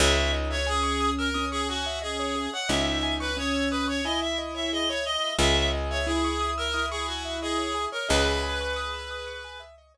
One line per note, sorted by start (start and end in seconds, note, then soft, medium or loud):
0.00 2.48 C#2 loud
0.00 0.56 D#4 loud
0.00 0.16 G#4 loud
0.00 0.32 E5 loud
0.17 0.32 C#5 medium
0.33 0.48 D#5 medium
0.50 0.67 C#5 loud
0.50 0.66 E5 medium
0.67 1.30 C#4 loud
0.67 1.10 G#4 loud
0.67 0.82 G#5 medium
0.83 0.98 C#6 medium
1.01 1.16 D#6 medium
1.18 1.45 A#4 medium
1.18 1.34 E6 medium
1.34 2.46 C#4 loud
1.34 1.49 D#6 medium
1.51 1.67 G#4 medium
1.51 1.67 C#6 medium
1.68 1.99 F#4 loud
1.68 1.85 G#5 medium
1.86 2.01 E5 medium
2.02 2.50 G#4 medium
2.02 2.17 D#5 medium
2.20 2.35 C#5 medium
2.36 2.51 G#4 medium
2.53 2.69 C#5 medium
2.53 2.69 F#5 medium
2.69 5.17 C#2 medium
2.69 3.28 D#4 loud
2.69 2.84 D#5 medium
2.69 3.14 E5 medium
2.86 3.01 E5 medium
3.03 3.18 G#5 medium
3.20 3.36 B4 medium
3.20 3.35 C#6 medium
3.37 4.01 C#4 loud
3.37 3.69 C#5 medium
3.37 3.52 D#6 medium
3.54 3.69 E6 medium
3.71 3.87 B4 medium
3.71 3.87 D#6 medium
3.88 4.04 C#5 medium
3.88 4.03 C#6 medium
4.04 5.29 E4 loud
4.04 4.20 D#5 medium
4.04 4.20 G#5 medium
4.21 4.37 E5 medium
4.21 4.38 E5 medium
4.38 4.54 D#5 medium
4.54 4.70 C#5 medium
4.54 4.71 E5 medium
4.72 4.88 G#4 medium
4.72 4.88 D#5 loud
4.88 5.04 C#5 medium
4.88 5.05 C#5 loud
5.05 5.33 D#5 loud
5.05 5.22 D#5 medium
5.23 5.38 E5 medium
5.38 7.87 C#2 medium
5.38 5.54 G#4 loud
5.38 6.00 G#4 loud
5.38 5.68 E5 loud
5.55 5.71 C#5 medium
5.73 5.88 D#5 medium
5.90 6.06 C#5 medium
5.90 6.06 E5 medium
6.06 6.67 E4 loud
6.06 6.50 G#4 medium
6.06 6.22 G#5 medium
6.24 6.40 C#6 medium
6.41 6.56 D#6 medium
6.58 6.85 A#4 medium
6.58 6.73 E6 medium
6.74 7.88 E4 loud
6.74 6.89 D#6 medium
6.90 7.06 G#4 medium
6.90 7.07 C#6 medium
7.07 7.37 F#4 medium
7.07 7.22 G#5 medium
7.25 7.40 E5 medium
7.42 7.85 G#4 medium
7.42 7.58 D#5 medium
7.58 7.73 C#5 medium
7.75 7.90 G#4 medium
7.92 8.08 A#4 medium
7.92 8.08 C#5 medium
8.09 9.97 C#2 medium
8.09 9.62 G#4 loud
8.09 9.61 B4 loud
8.09 8.24 D#5 medium
8.26 8.41 E5 medium
8.43 8.58 G#5 medium
8.61 8.76 C#6 medium
8.76 8.91 D#6 medium
8.93 9.09 E6 medium
9.11 9.26 D#6 medium
9.27 9.42 C#6 medium
9.44 9.59 G#5 medium
9.60 9.75 E5 medium
9.78 9.93 D#5 medium
9.94 9.97 C#5 medium